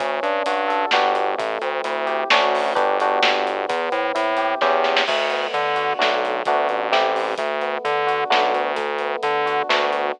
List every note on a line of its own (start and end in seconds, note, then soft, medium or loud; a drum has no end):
0.00 0.20 D2 medium
0.00 0.87 C#4 medium
0.00 kick loud
0.00 closed hi-hat medium
0.23 0.42 G2 medium
0.23 0.90 D4 medium
0.23 closed hi-hat medium
0.46 0.85 G2 medium
0.46 0.91 F#4 medium
0.46 closed hi-hat loud
0.68 0.90 A4 medium
0.68 closed hi-hat medium
0.91 1.35 G1 loud
0.91 1.35 B3 medium
0.91 1.35 D4 medium
0.91 1.35 F#4 medium
0.91 1.35 G4 medium
0.91 snare loud
1.15 closed hi-hat medium
1.38 1.58 A1 medium
1.38 2.26 A3 medium
1.38 kick loud
1.38 closed hi-hat medium
1.62 1.81 D2 medium
1.62 2.28 C4 medium
1.62 closed hi-hat medium
1.84 2.24 D2 medium
1.84 2.28 E4 medium
1.84 closed hi-hat medium
2.06 2.28 G4 medium
2.06 closed hi-hat medium
2.30 2.73 D2 medium
2.30 2.73 A3 medium
2.30 2.73 C#4 medium
2.30 2.73 D4 medium
2.30 2.73 F#4 medium
2.30 snare loud
2.55 open hi-hat medium
2.75 3.19 G1 medium
2.75 2.97 B3 medium
2.75 2.97 D4 loud
2.75 2.97 F#4 medium
2.75 2.97 G4 medium
2.75 kick loud
2.75 closed hi-hat medium
3.00 3.66 B3 medium
3.00 3.66 D4 medium
3.00 3.66 F#4 medium
3.00 3.66 G4 medium
3.00 closed hi-hat medium
3.23 3.66 G1 medium
3.23 snare loud
3.47 closed hi-hat medium
3.69 3.89 E2 loud
3.69 4.56 B3 medium
3.69 kick loud
3.69 closed hi-hat loud
3.92 4.12 A2 medium
3.92 4.58 C4 medium
3.92 closed hi-hat medium
4.15 4.55 A2 medium
4.15 4.58 E4 medium
4.15 closed hi-hat loud
4.37 4.60 G4 medium
4.37 closed hi-hat medium
4.61 5.04 E2 medium
4.61 5.03 B3 medium
4.61 5.03 C#4 loud
4.61 5.03 E4 medium
4.61 5.03 G4 medium
4.61 kick medium
4.61 snare medium
4.84 snare medium
4.97 snare loud
5.07 5.47 D2 medium
5.07 5.96 A3 medium
5.07 kick medium
5.07 crash loud
5.30 5.96 B3 medium
5.30 closed hi-hat medium
5.53 5.93 D3 medium
5.53 5.97 D4 medium
5.53 closed hi-hat medium
5.76 5.98 F#4 medium
5.76 closed hi-hat medium
5.99 6.42 B1 medium
5.99 6.40 A3 medium
5.99 6.40 B3 medium
5.99 6.40 D4 medium
5.99 6.40 F#4 medium
5.99 snare medium
6.25 closed hi-hat medium
6.45 6.68 D2 medium
6.45 6.89 A3 medium
6.45 6.89 B3 medium
6.45 6.89 D4 medium
6.45 6.89 F#4 medium
6.45 kick loud
6.45 closed hi-hat medium
6.69 7.35 A1 medium
6.69 closed hi-hat medium
6.92 7.34 A3 medium
6.92 7.34 C4 medium
6.92 7.34 E4 medium
6.92 7.34 G4 medium
6.92 snare medium
7.16 open hi-hat medium
7.38 7.78 D2 medium
7.38 8.26 A3 medium
7.38 kick medium
7.38 closed hi-hat medium
7.61 8.28 B3 medium
7.61 closed hi-hat medium
7.85 8.24 D3 medium
7.85 8.29 D4 medium
7.85 closed hi-hat medium
8.07 8.29 F#4 medium
8.07 closed hi-hat medium
8.30 8.53 B1 medium
8.30 8.72 A3 medium
8.30 8.72 B3 medium
8.30 8.72 D4 medium
8.30 8.72 F#4 medium
8.30 snare medium
8.54 9.16 D2 medium
8.54 closed hi-hat medium
8.76 9.64 A3 medium
8.76 kick medium
8.76 closed hi-hat medium
8.99 9.67 B3 medium
8.99 closed hi-hat medium
9.23 9.62 D3 medium
9.23 9.68 D4 medium
9.23 closed hi-hat medium
9.46 9.68 F#4 medium
9.46 closed hi-hat medium
9.69 10.12 D2 medium
9.69 10.11 A3 medium
9.69 10.11 B3 medium
9.69 10.11 D4 medium
9.69 10.11 F#4 medium
9.69 snare loud
9.93 closed hi-hat medium